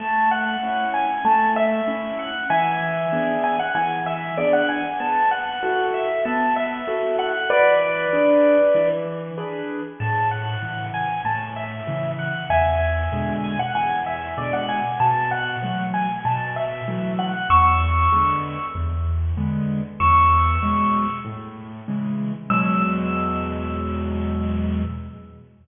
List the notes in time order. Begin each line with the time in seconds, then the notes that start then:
0.00 A3 A5
0.31 F#5
0.63 C#4 E4
0.94 G#5
1.25 A3 A5
1.56 E5
1.88 C#4 E4
2.19 F#5
2.50 E3 E5 G#5
3.13 B3 D4 G#4
3.44 G#5
3.59 F#5
3.75 E3 G#5
4.06 E5
4.38 B3 D4 G#4 D5
4.53 F#5
4.69 G#5
5.00 B3 A5
5.31 F#5
5.63 E4 F#4 A4
5.94 E5
6.25 B3 A5
6.56 E5
6.88 E4 F#4 A4
7.19 F#5
7.50 E3 B4 D5
8.13 D4 G#4 B4
8.75 E3
9.38 D4 G#4 B4
10.00 A2 A5
10.31 F#5
10.63 C#3 E3
10.94 G#5
11.25 A2 A5
11.56 E5
11.87 C#3 E3
12.19 F#5
12.50 E2 E5 G#5
13.12 B2 D3 G#3
13.44 G#5
13.59 F#5
13.75 E2 G#5
14.06 E5
14.38 B2 D3 G#3 D5
14.53 F#5
14.69 G#5
15.00 B2 A5
15.31 F#5
15.62 E3 F#3 A3
15.94 G#5
16.25 B2 A5
16.56 E5
16.88 E3 F#3 A3
17.19 F#5
17.50 E2 C#6 E6
18.12 D3 G#3 B3
18.75 E2
19.37 D3 G#3 B3
20.00 E2 C#6 E6
20.62 B2 F#3 G#3
21.25 A2
21.88 C#3 E3 G#3
22.50 E2 B2 F#3 G#3 E6